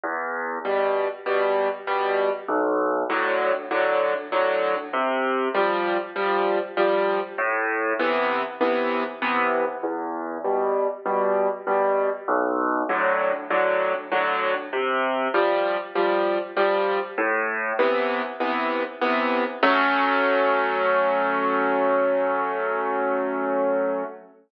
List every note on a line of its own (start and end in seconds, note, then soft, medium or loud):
0.03 0.59 E2 loud
0.65 1.08 B2 medium
0.65 1.08 G3 medium
1.26 1.69 B2 medium
1.26 1.69 G3 medium
1.87 2.30 B2 medium
1.87 2.30 G3 medium
2.48 3.03 B1 loud
3.10 3.52 A2 medium
3.10 3.52 D3 medium
3.10 3.52 F#3 medium
3.71 4.14 A2 medium
3.71 4.14 D3 medium
3.71 4.14 F#3 medium
4.32 4.75 A2 medium
4.32 4.75 D3 medium
4.32 4.75 F#3 medium
4.93 5.48 C3 medium
5.54 5.97 F3 medium
5.54 5.97 G3 medium
6.16 6.59 F3 medium
6.16 6.59 G3 medium
6.77 7.20 F3 medium
6.77 7.20 G3 medium
7.38 7.93 A2 loud
7.99 8.42 C3 medium
7.99 8.42 E3 medium
7.99 8.42 B3 medium
8.61 9.03 C3 medium
8.61 9.03 E3 medium
8.61 9.03 B3 medium
9.22 9.65 C3 medium
9.22 9.65 E3 medium
9.22 9.65 B3 medium
9.83 10.38 E2 loud
10.44 10.87 B2 medium
10.44 10.87 G3 medium
11.05 11.48 B2 medium
11.05 11.48 G3 medium
11.67 12.10 B2 medium
11.67 12.10 G3 medium
12.28 12.83 B1 loud
12.89 13.32 A2 medium
12.89 13.32 D3 medium
12.89 13.32 F#3 medium
13.50 13.93 A2 medium
13.50 13.93 D3 medium
13.50 13.93 F#3 medium
14.12 14.54 A2 medium
14.12 14.54 D3 medium
14.12 14.54 F#3 medium
14.73 15.28 C3 medium
15.34 15.77 F3 medium
15.34 15.77 G3 medium
15.95 16.38 F3 medium
15.95 16.38 G3 medium
16.57 16.99 F3 medium
16.57 16.99 G3 medium
17.18 17.73 A2 loud
17.79 18.22 C3 medium
17.79 18.22 E3 medium
17.79 18.22 B3 medium
18.40 18.83 C3 medium
18.40 18.83 E3 medium
18.40 18.83 B3 medium
19.01 19.44 C3 medium
19.01 19.44 E3 medium
19.01 19.44 B3 medium
19.63 24.03 F#3 loud
19.63 24.03 A3 loud
19.63 24.03 C#4 loud